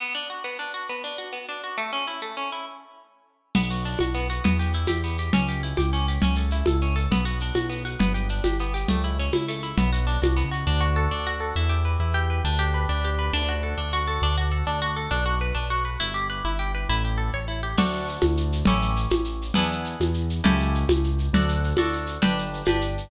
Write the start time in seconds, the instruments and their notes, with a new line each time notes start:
0.00 orchestral harp B3
0.15 orchestral harp D4
0.30 orchestral harp F#4
0.44 orchestral harp B3
0.59 orchestral harp D4
0.74 orchestral harp F#4
0.89 orchestral harp B3
1.04 orchestral harp D4
1.18 orchestral harp F#4
1.33 orchestral harp B3
1.49 orchestral harp D4
1.64 orchestral harp F#4
1.78 orchestral harp A3
1.93 orchestral harp C#4
2.07 orchestral harp E4
2.22 orchestral harp A3
2.37 orchestral harp C#4
2.52 orchestral harp E4
3.55 acoustic grand piano B1, orchestral harp B3, crash, low conga, shaker
3.70 orchestral harp F#4, shaker
3.85 orchestral harp D4, shaker
3.99 acoustic grand piano B1, orchestral harp F#4, high conga, shaker
4.14 orchestral harp B3, shaker
4.29 orchestral harp F#4, shaker
4.44 acoustic grand piano E2, orchestral harp B3, low conga, shaker
4.59 orchestral harp G4, shaker
4.73 orchestral harp E4, shaker
4.87 acoustic grand piano E2, orchestral harp G4, high conga, shaker
5.03 orchestral harp B3, shaker
5.18 orchestral harp G4, shaker
5.33 acoustic grand piano C#2, orchestral harp C#4, low conga, shaker
5.48 orchestral harp G4, shaker
5.63 orchestral harp E4, shaker
5.77 acoustic grand piano C#2, orchestral harp G4, high conga, shaker
5.93 orchestral harp C#4, shaker
6.08 orchestral harp G4, shaker
6.22 acoustic grand piano C#2, orchestral harp C#4, low conga, shaker
6.36 orchestral harp A4, shaker
6.50 orchestral harp E4, shaker
6.66 acoustic grand piano C#2, orchestral harp A4, high conga, shaker
6.81 orchestral harp C#4, shaker
6.96 orchestral harp A4, shaker
7.11 acoustic grand piano B1, orchestral harp B3, low conga, shaker
7.25 orchestral harp F#4, shaker
7.40 orchestral harp D4, shaker
7.55 acoustic grand piano B1, orchestral harp F#4, high conga, shaker
7.70 orchestral harp B3, shaker
7.85 orchestral harp F#4, shaker
7.99 acoustic grand piano G1, orchestral harp B3, low conga, shaker
8.14 orchestral harp G4, shaker
8.29 orchestral harp D4, shaker
8.44 acoustic grand piano G1, orchestral harp G4, high conga, shaker
8.59 orchestral harp B3, shaker
8.74 orchestral harp G4, shaker
8.88 acoustic grand piano C#2, orchestral harp A3, low conga, shaker
9.03 orchestral harp E4, shaker
9.18 orchestral harp C#4, shaker
9.33 acoustic grand piano C#2, orchestral harp E4, high conga, shaker
9.48 orchestral harp A3, shaker
9.62 orchestral harp E4, shaker
9.77 acoustic grand piano B1, orchestral harp B3, low conga, shaker
9.93 orchestral harp F#4, shaker
10.07 orchestral harp D4, shaker
10.22 acoustic grand piano C2, orchestral harp F#4, high conga, shaker
10.36 orchestral harp B3, shaker
10.44 acoustic grand piano C#2
10.51 orchestral harp F#4, shaker
10.67 acoustic grand piano D2, orchestral harp D4
10.81 orchestral harp F#4
10.96 orchestral harp A4
11.11 acoustic grand piano D2, orchestral harp D4
11.27 orchestral harp F#4
11.40 orchestral harp A4
11.56 acoustic grand piano E2, orchestral harp E4
11.69 orchestral harp G4
11.85 orchestral harp B4
12.00 acoustic grand piano E2, orchestral harp E4
12.14 orchestral harp G4
12.30 orchestral harp B4
12.45 acoustic grand piano D2, orchestral harp D4
12.59 orchestral harp G4
12.74 orchestral harp B4
12.89 acoustic grand piano D2, orchestral harp D4
13.05 orchestral harp G4
13.19 orchestral harp B4
13.33 acoustic grand piano D2, orchestral harp D4
13.49 orchestral harp F#4
13.63 orchestral harp A4
13.78 acoustic grand piano D2, orchestral harp D4
13.93 orchestral harp F#4
14.07 orchestral harp A4
14.22 acoustic grand piano D2, orchestral harp D4
14.38 orchestral harp F#4
14.52 orchestral harp A4
14.67 acoustic grand piano D2, orchestral harp D4
14.82 orchestral harp F#4
14.96 orchestral harp A4
15.11 acoustic grand piano B1, orchestral harp D4
15.26 orchestral harp F#4
15.41 orchestral harp B4
15.55 acoustic grand piano B1, orchestral harp D4
15.70 orchestral harp F#4
15.85 orchestral harp B4
16.00 acoustic grand piano G1, orchestral harp E4
16.14 orchestral harp G4
16.30 orchestral harp B4
16.45 acoustic grand piano G1, orchestral harp E4
16.59 orchestral harp G4
16.75 orchestral harp B4
16.89 acoustic grand piano A1, orchestral harp E4
17.05 orchestral harp G4
17.18 orchestral harp A4
17.34 acoustic grand piano A1, orchestral harp C#5
17.48 orchestral harp E4
17.63 orchestral harp G4
17.77 acoustic grand piano D2, orchestral harp D4 F#4 A4, crash, low conga, shaker
17.92 shaker
18.08 shaker
18.21 acoustic grand piano D2, high conga, shaker
18.37 shaker
18.52 shaker
18.65 acoustic grand piano A1, orchestral harp C#4 E4 G4 A4, low conga, shaker
18.81 shaker
18.96 shaker
19.10 acoustic grand piano A1, high conga, shaker
19.24 shaker
19.42 shaker
19.54 acoustic grand piano E2, orchestral harp B3 D4 E4 G#4, low conga, shaker
19.71 shaker
19.85 shaker
20.00 acoustic grand piano E2, high conga, shaker
20.14 shaker
20.30 shaker
20.44 acoustic grand piano C#2, orchestral harp C#4 E4 G4 A4, low conga, shaker
20.60 shaker
20.74 shaker
20.89 acoustic grand piano C#2, high conga, shaker
21.04 shaker
21.18 shaker
21.33 acoustic grand piano D2, orchestral harp D4 F#4 A4, low conga, shaker
21.48 shaker
21.64 shaker
21.77 acoustic grand piano D2, orchestral harp D4 F#4 A4, high conga, shaker
21.93 shaker
22.06 shaker
22.22 acoustic grand piano G1, orchestral harp D4 G4 B4, low conga, shaker
22.38 shaker
22.53 shaker
22.65 acoustic grand piano G1, orchestral harp D4 G4 B4, high conga, shaker
22.81 shaker
22.98 shaker